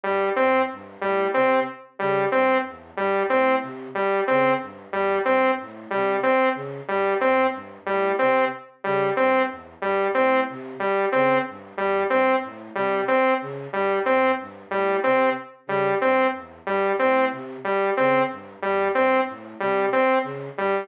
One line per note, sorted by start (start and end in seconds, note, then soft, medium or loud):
0.04 0.31 G2 medium
0.04 0.30 G3 medium
0.36 0.63 E2 medium
0.36 0.62 C4 medium
0.71 0.97 G2 medium
1.01 1.27 A2 medium
1.01 1.27 G3 medium
1.34 1.60 C3 medium
1.34 1.60 C4 medium
1.99 2.26 C#3 medium
1.99 2.25 G3 medium
2.32 2.59 G2 medium
2.32 2.58 C4 medium
2.65 2.91 E2 medium
2.97 3.23 G2 medium
2.97 3.23 G3 medium
3.30 3.56 A2 medium
3.30 3.56 C4 medium
3.61 3.87 C3 medium
3.95 4.21 G3 medium
4.27 4.55 C#3 medium
4.27 4.54 C4 medium
4.61 4.87 G2 medium
4.90 5.16 E2 medium
4.90 5.19 G3 medium
5.25 5.51 G2 medium
5.25 5.51 C4 medium
5.60 5.86 A2 medium
5.90 6.18 C3 medium
5.90 6.17 G3 medium
6.23 6.49 C4 medium
6.54 6.80 C#3 medium
6.88 7.16 G2 medium
6.88 7.14 G3 medium
7.21 7.47 E2 medium
7.21 7.47 C4 medium
7.52 7.78 G2 medium
7.86 8.13 A2 medium
7.86 8.12 G3 medium
8.19 8.46 C3 medium
8.19 8.45 C4 medium
8.84 9.11 C#3 medium
8.84 9.10 G3 medium
9.17 9.45 G2 medium
9.17 9.43 C4 medium
9.48 9.74 E2 medium
9.81 10.07 G2 medium
9.81 10.08 G3 medium
10.14 10.42 A2 medium
10.14 10.40 C4 medium
10.48 10.74 C3 medium
10.80 11.06 G3 medium
11.12 11.39 C#3 medium
11.12 11.38 C4 medium
11.47 11.73 G2 medium
11.77 12.04 E2 medium
11.77 12.04 G3 medium
12.10 12.36 G2 medium
12.10 12.36 C4 medium
12.43 12.69 A2 medium
12.75 13.01 C3 medium
12.75 13.01 G3 medium
13.08 13.34 C4 medium
13.41 13.67 C#3 medium
13.73 13.99 G2 medium
13.73 13.99 G3 medium
14.06 14.32 E2 medium
14.06 14.32 C4 medium
14.39 14.65 G2 medium
14.70 14.96 A2 medium
14.70 14.97 G3 medium
15.04 15.30 C3 medium
15.04 15.30 C4 medium
15.66 15.93 C#3 medium
15.66 15.95 G3 medium
16.01 16.27 G2 medium
16.01 16.27 C4 medium
16.33 16.59 E2 medium
16.65 16.91 G2 medium
16.65 16.93 G3 medium
16.99 17.27 A2 medium
16.99 17.25 C4 medium
17.30 17.57 C3 medium
17.64 17.90 G3 medium
17.97 18.24 C#3 medium
17.97 18.23 C4 medium
18.30 18.56 G2 medium
18.62 18.89 E2 medium
18.62 18.88 G3 medium
18.95 19.21 G2 medium
18.95 19.21 C4 medium
19.28 19.54 A2 medium
19.60 19.86 C3 medium
19.60 19.86 G3 medium
19.93 20.19 C4 medium
20.23 20.49 C#3 medium
20.57 20.83 G2 medium
20.57 20.84 G3 medium